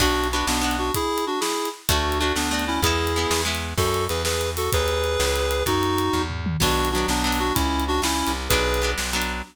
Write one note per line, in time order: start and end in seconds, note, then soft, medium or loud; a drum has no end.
0.00 0.43 B1 loud
0.00 0.28 B3 medium
0.00 0.28 D4 medium
0.00 0.28 F#4 medium
0.00 kick medium
0.00 crash medium
0.24 closed hi-hat medium
0.32 0.61 B3 medium
0.32 0.45 D4 medium
0.32 0.62 D4 medium
0.32 0.45 F#4 medium
0.32 0.62 F#4 medium
0.47 0.91 B1 medium
0.47 0.76 B3 medium
0.47 0.76 D4 medium
0.47 snare loud
0.61 0.90 B3 medium
0.61 0.90 D4 medium
0.61 0.90 F#4 medium
0.71 closed hi-hat medium
0.78 0.92 D4 medium
0.78 0.92 F#4 medium
0.94 1.25 E4 medium
0.94 1.25 G#4 loud
0.94 kick medium
0.94 closed hi-hat medium
1.18 closed hi-hat medium
1.27 1.40 D4 medium
1.27 1.40 F#4 medium
1.40 1.69 E4 medium
1.40 1.69 G#4 medium
1.40 snare medium
1.65 closed hi-hat medium
1.89 2.32 D2 loud
1.89 2.18 A3 medium
1.89 2.18 D4 medium
1.89 2.19 D4 medium
1.89 2.19 F#4 medium
1.89 2.18 F#4 medium
1.89 kick medium
1.89 closed hi-hat loud
2.12 closed hi-hat medium
2.19 2.49 A3 medium
2.19 2.32 D4 medium
2.19 2.49 D4 medium
2.19 2.32 F#4 medium
2.23 2.49 F#4 medium
2.36 2.79 D2 medium
2.36 2.65 B3 medium
2.36 2.65 D4 medium
2.36 snare medium
2.51 2.80 A3 medium
2.51 2.80 D4 medium
2.51 2.80 F#4 medium
2.59 closed hi-hat medium
2.67 2.80 C#4 medium
2.67 2.80 E4 medium
2.82 3.26 E2 loud
2.82 3.13 G#3 medium
2.82 3.13 B3 medium
2.82 3.42 E4 medium
2.82 3.42 G#4 loud
2.82 kick medium
2.82 closed hi-hat medium
2.86 3.13 E4 medium
3.07 closed hi-hat medium
3.16 3.44 G#3 medium
3.16 3.45 B3 medium
3.16 3.45 E4 medium
3.31 3.74 E2 medium
3.31 snare loud
3.45 3.74 G#3 medium
3.45 3.74 B3 medium
3.45 3.74 E4 medium
3.55 closed hi-hat medium
3.77 4.07 F#2 loud
3.77 4.05 F#4 medium
3.77 4.05 A4 medium
3.77 kick medium
3.77 crash medium
3.94 closed hi-hat medium
4.09 4.69 E2 medium
4.09 4.22 G#4 medium
4.09 4.22 B4 medium
4.09 closed hi-hat medium
4.25 4.50 G#4 medium
4.25 4.50 B4 medium
4.25 snare medium
4.41 closed hi-hat medium
4.57 4.70 F#4 medium
4.57 4.70 A4 medium
4.57 open hi-hat medium
4.72 5.17 D#2 loud
4.72 5.63 G#4 medium
4.72 5.63 B4 loud
4.72 kick medium
4.72 closed hi-hat medium
4.88 closed hi-hat medium
5.04 closed hi-hat medium
5.20 5.63 C#2 loud
5.20 snare medium
5.35 closed hi-hat medium
5.51 closed hi-hat medium
5.66 6.10 F#2 medium
5.66 6.22 D#4 medium
5.66 6.22 F#4 loud
5.66 kick medium
5.66 closed hi-hat medium
5.83 closed hi-hat medium
5.98 closed hi-hat medium
6.13 6.57 E2 medium
6.13 kick medium
6.30 floor tom medium
6.46 mid tom medium
6.60 7.05 B1 loud
6.60 6.89 F#3 medium
6.60 6.89 B3 medium
6.60 6.89 D4 medium
6.60 6.89 F#4 loud
6.60 kick medium
6.60 crash medium
6.85 closed hi-hat medium
6.91 7.24 F#3 medium
6.91 7.06 D4 medium
6.91 7.06 F#4 medium
6.96 7.24 B3 medium
6.96 7.24 D4 medium
7.08 7.52 B1 medium
7.08 7.39 B3 medium
7.08 7.39 D4 medium
7.08 snare medium
7.24 7.53 F#3 medium
7.24 7.53 B3 medium
7.24 7.53 D4 medium
7.32 open hi-hat medium
7.39 7.53 D4 medium
7.39 7.53 F#4 medium
7.54 8.00 C#2 medium
7.54 7.84 C#4 medium
7.54 7.84 E4 medium
7.54 kick medium
7.54 closed hi-hat medium
7.80 closed hi-hat medium
7.88 8.01 D4 medium
7.88 8.01 F#4 loud
8.02 8.23 C#2 medium
8.02 8.32 C#4 medium
8.02 8.32 E4 medium
8.02 snare loud
8.27 8.49 C2 medium
8.27 closed hi-hat medium
8.49 8.94 B1 loud
8.49 8.79 F#3 medium
8.49 8.79 B3 medium
8.49 8.79 D4 medium
8.49 8.91 G#4 loud
8.49 8.91 B4 loud
8.49 kick medium
8.49 closed hi-hat medium
8.74 closed hi-hat medium
8.82 9.11 F#3 medium
8.82 9.11 B3 medium
8.82 9.11 D4 medium
8.98 9.42 B1 medium
8.98 snare medium
9.13 9.42 F#3 medium
9.13 9.42 B3 medium
9.13 9.42 D4 medium
9.22 closed hi-hat medium